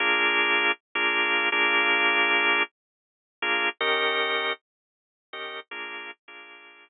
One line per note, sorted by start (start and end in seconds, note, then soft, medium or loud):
0.00 0.72 A#3 loud
0.00 0.72 D4 loud
0.00 0.72 F4 loud
0.00 0.72 G#4 loud
0.95 1.49 A#3 loud
0.95 1.49 D4 loud
0.95 1.49 F4 loud
0.95 1.49 G#4 medium
1.52 2.63 A#3 loud
1.52 2.63 D4 loud
1.52 2.63 F4 loud
1.52 2.63 G#4 loud
3.42 3.69 A#3 loud
3.42 3.69 D4 medium
3.42 3.69 F4 loud
3.42 3.69 G#4 medium
3.81 4.53 D#3 loud
3.81 4.53 C#4 loud
3.81 4.53 G4 loud
3.81 4.53 A#4 loud
5.33 5.60 D#3 loud
5.33 5.60 C#4 medium
5.33 5.60 G4 loud
5.33 5.60 A#4 medium
5.71 6.11 A#3 loud
5.71 6.11 D4 loud
5.71 6.11 F4 loud
5.71 6.11 G#4 loud
6.28 6.89 A#3 medium
6.28 6.89 D4 medium
6.28 6.89 F4 medium
6.28 6.89 G#4 medium